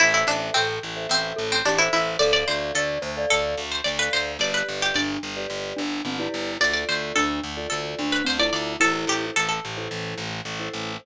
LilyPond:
<<
  \new Staff \with { instrumentName = "Pizzicato Strings" } { \time 4/4 \key a \minor \tempo 4 = 109 e'16 e'16 d'8 c'4 c'8. c'16 d'16 e'16 e'8 | d''16 d''16 c''8 a'4 a'8. c''16 d''16 b'16 c''8 | d''16 b'8 g'16 d''2 r4 | d''16 d''16 c''8 a'4 a'8. b'16 c''16 d''16 d''8 |
a'8 g'8 a'16 a'2~ a'8. | }
  \new Staff \with { instrumentName = "Glockenspiel" } { \time 4/4 \key a \minor r4 a'8 r4 a'8 g'16 c''8. | a'8 d''8 d''8 c''16 d''8. r4. | r4 d'8 r4 d'8 c'16 e'8. | r4 d'8 r4 d'8 c'16 e'8. |
e'4 r2. | }
  \new Staff \with { instrumentName = "Vibraphone" } { \time 4/4 \key a \minor <a' c'' e''>16 <a' c'' e''>4. <a' c'' e''>4. <a' c'' e''>8. | <a' d'' f''>16 <a' d'' f''>4. <a' d'' f''>4. <a' d'' f''>8. | <g' b' d''>16 <g' b' d''>4. <g' b' d''>4. <g' b' d''>8. | <f' a' d''>16 <f' a' d''>4. <f' a' d''>4. <f' a' d''>8. |
<e' a' c''>16 <e' a' c''>4. <e' a' c''>4. <e' a' c''>8. | }
  \new Staff \with { instrumentName = "Electric Bass (finger)" } { \clef bass \time 4/4 \key a \minor a,,8 a,,8 a,,8 a,,8 a,,8 a,,8 a,,8 a,,8 | d,8 d,8 d,8 d,8 d,8 d,8 d,8 d,8 | g,,8 g,,8 g,,8 g,,8 g,,8 g,,8 g,,8 g,,8 | d,8 d,8 d,8 d,8 d,8 d,8 d,8 d,8 |
a,,8 a,,8 a,,8 a,,8 a,,8 a,,8 a,,8 a,,8 | }
>>